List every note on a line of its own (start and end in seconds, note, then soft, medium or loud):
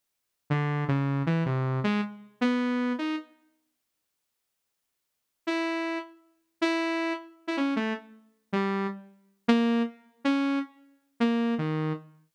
0.50 0.84 D3 medium
0.88 1.23 C#3 medium
1.26 1.44 E3 medium
1.46 1.80 C3 medium
1.84 2.01 G#3 medium
2.41 2.93 B3 medium
2.98 3.16 D#4 soft
5.47 5.98 E4 medium
6.61 7.13 E4 medium
7.47 7.56 E4 medium
7.57 7.74 C#4 medium
7.76 7.93 A3 medium
8.53 8.87 G3 medium
9.48 9.82 A#3 loud
10.25 10.59 C#4 medium
11.20 11.54 A#3 medium
11.58 11.93 D#3 medium